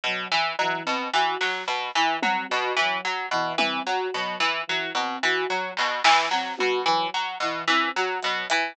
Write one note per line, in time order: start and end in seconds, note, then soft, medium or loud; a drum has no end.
0.04 0.25 B2 medium
0.04 0.27 F#3 medium
0.04 kick medium
0.31 0.53 E3 medium
0.59 0.82 E3 medium
0.59 0.81 F#3 medium
0.59 cowbell medium
0.85 1.08 B2 medium
0.85 1.07 C4 medium
1.13 1.35 E3 medium
1.13 1.36 F#4 medium
1.41 1.63 F#3 medium
1.41 snare medium
1.68 1.89 B2 medium
1.68 closed hi-hat medium
1.95 2.17 E3 medium
2.23 2.44 F#3 medium
2.23 2.46 C4 medium
2.23 high tom loud
2.49 2.73 B2 medium
2.49 2.71 F#4 medium
2.76 2.98 E3 medium
2.76 3.01 F#3 medium
2.76 floor tom medium
3.05 3.26 F#3 medium
3.31 3.53 B2 medium
3.31 3.54 E3 medium
3.31 floor tom medium
3.58 3.80 E3 medium
3.58 3.80 C4 medium
3.58 high tom loud
3.86 4.08 F#3 medium
3.86 4.08 F#4 medium
4.14 4.36 B2 medium
4.14 4.36 F#3 medium
4.40 4.62 E3 medium
4.67 4.89 E3 medium
4.67 4.91 F#3 medium
4.95 5.16 B2 medium
4.95 5.18 C4 medium
4.95 cowbell medium
5.23 5.45 E3 medium
5.23 5.45 F#4 medium
5.49 5.71 F#3 medium
5.77 6.00 B2 medium
5.77 clap medium
6.03 6.25 E3 medium
6.03 6.26 E3 medium
6.03 snare loud
6.31 6.53 F#3 medium
6.31 6.54 C4 medium
6.31 snare medium
6.57 6.82 B2 medium
6.57 6.79 F#4 medium
6.57 high tom medium
6.86 7.07 E3 medium
6.86 7.07 F#3 medium
7.14 7.36 F#3 medium
7.40 7.62 B2 medium
7.40 7.64 E3 medium
7.67 7.89 E3 medium
7.67 7.90 C4 medium
7.96 8.18 F#3 medium
7.96 8.18 F#4 medium
8.21 8.46 B2 medium
8.21 8.43 F#3 medium
8.21 closed hi-hat medium
8.50 8.73 E3 medium
8.50 closed hi-hat loud